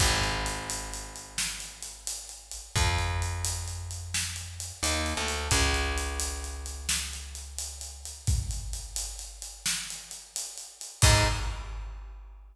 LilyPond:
<<
  \new Staff \with { instrumentName = "Electric Bass (finger)" } { \clef bass \time 12/8 \key aes \major \tempo 4. = 87 aes,,1. | f,1~ f,8 ees,8. d,8. | des,1. | r1. |
aes,4. r1 r8 | }
  \new DrumStaff \with { instrumentName = "Drums" } \drummode { \time 12/8 <cymc bd>8 hh8 hh8 hh8 hh8 hh8 sn8 hh8 hh8 hh8 hh8 hh8 | <hh bd>8 hh8 hh8 hh8 hh8 hh8 sn8 hh8 hh8 hh8 hh8 hh8 | <hh bd>8 hh8 hh8 hh8 hh8 hh8 sn8 hh8 hh8 hh8 hh8 hh8 | <hh bd>8 hh8 hh8 hh8 hh8 hh8 sn8 hh8 hh8 hh8 hh8 hh8 |
<cymc bd>4. r4. r4. r4. | }
>>